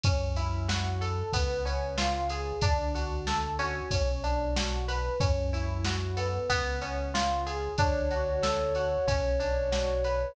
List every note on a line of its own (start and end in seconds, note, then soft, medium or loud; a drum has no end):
0.03 1.23 F#2 medium
0.03 1.27 C#4 medium
0.03 0.34 C#4 loud
0.03 kick loud
0.03 ride loud
0.36 1.28 E4 medium
0.36 0.66 E4 medium
0.36 ride medium
0.68 1.30 F#4 medium
0.68 0.98 F#4 medium
0.68 snare loud
1.01 1.32 A4 medium
1.01 1.30 A4 medium
1.01 ride medium
1.33 2.53 C#2 medium
1.33 1.62 B3 loud
1.33 2.56 B3 medium
1.33 kick loud
1.33 ride loud
1.65 2.57 C#4 medium
1.65 1.95 C#4 medium
1.65 ride medium
1.97 2.59 F4 medium
1.97 2.27 F4 medium
1.97 snare loud
2.29 2.59 G#4 medium
2.29 2.61 G#4 medium
2.29 ride medium
2.61 3.81 D2 medium
2.61 2.91 D4 loud
2.61 3.85 D4 medium
2.61 kick loud
2.61 ride loud
2.94 3.87 F#4 soft
2.94 3.24 F#4 medium
2.94 ride medium
3.27 3.88 A4 medium
3.27 3.56 A4 medium
3.27 snare loud
3.59 5.14 C#4 medium
3.59 3.88 F#4 medium
3.59 ride medium
3.91 5.10 B1 medium
3.91 4.20 C#4 loud
3.91 kick loud
3.91 ride loud
4.24 4.53 D4 medium
4.24 5.16 D4 medium
4.24 ride medium
4.56 4.85 F#4 medium
4.56 5.18 F#4 medium
4.56 snare loud
4.88 5.17 B4 medium
4.88 5.19 B4 medium
4.88 ride medium
5.20 6.39 F#2 medium
5.20 5.49 C#4 loud
5.20 6.43 C#4 medium
5.20 kick loud
5.20 ride loud
5.53 5.82 E4 medium
5.53 6.45 E4 medium
5.53 ride medium
5.84 6.14 F#4 medium
5.84 6.46 F#4 soft
5.84 snare loud
6.17 6.79 B3 loud
6.17 6.47 A4 medium
6.17 ride medium
6.49 7.69 C#2 medium
6.49 7.72 B3 medium
6.49 kick medium
6.49 ride loud
6.81 7.73 C#4 medium
6.81 7.11 C#4 medium
6.81 ride medium
7.14 7.43 F4 medium
7.14 7.75 F4 medium
7.14 snare loud
7.46 7.75 G#4 medium
7.46 7.77 G#4 medium
7.46 ride medium
7.78 8.98 D2 medium
7.78 9.01 D4 medium
7.78 8.08 D4 loud
7.78 10.35 C#5 medium
7.78 kick loud
7.78 ride loud
8.10 8.40 F#4 medium
8.10 8.75 F#4 medium
8.10 ride medium
8.42 9.04 A4 medium
8.42 8.72 A4 medium
8.42 snare loud
8.75 9.04 F#4 medium
8.75 9.06 F#4 medium
8.75 ride medium
9.07 10.26 B1 medium
9.07 10.30 C#4 medium
9.07 9.37 C#4 loud
9.07 kick loud
9.07 ride loud
9.40 10.31 D4 medium
9.40 9.69 D4 medium
9.40 ride medium
9.72 10.33 F#4 medium
9.72 10.01 F#4 medium
9.72 snare loud
10.04 10.33 B4 medium
10.04 10.35 B4 medium
10.04 ride medium